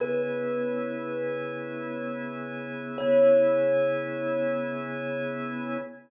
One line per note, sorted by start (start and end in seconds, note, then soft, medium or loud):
0.00 2.97 C#3 medium
0.00 2.97 B3 medium
0.00 2.97 E4 medium
0.00 2.97 G#4 medium
0.00 2.55 B4 medium
2.98 5.78 C#3 loud
2.98 5.78 B3 loud
2.98 5.78 E4 loud
2.98 5.78 G#4 loud
2.98 5.75 C#5 loud